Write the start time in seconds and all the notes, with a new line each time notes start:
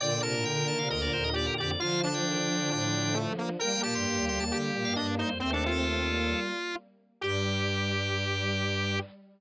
0.00 A#2 D3 D5 G5
0.11 G5
0.22 C3 A#4 A5
0.34 A2 A5
0.45 D3 G5
0.56 G5
0.68 D#3 A5
0.79 C3 F5
0.90 D2 A#4 D#5
1.02 D5
1.13 D#2 C5
1.24 D#5
1.33 G4 D5
1.47 A#4
1.58 F2 G4 D5
1.69 D5
1.80 D3 F3 F4 F5
2.03 D4 A5
2.14 F3 G5
2.26 D#3
2.37 D3
2.48 F3
2.60 D3
2.71 A2 D4
3.14 A3
3.38 A#3
3.59 G3 A#3 A#4 G5
3.83 A#2 G4 A5
3.95 G2 C6
4.06 G2
4.17 D#2
4.28 D2 C6
4.40 D#2 A5
4.51 D3 G4
4.74 A#2
4.85 G2 F5
4.96 G2 D4 D#5
5.18 D#4 C5
5.30 F2
5.40 D#2 A3 C4 C5
5.53 D4 A4
5.66 F4
5.86 A3 C4
6.08 G3 A#3
7.21 G2 G3 G4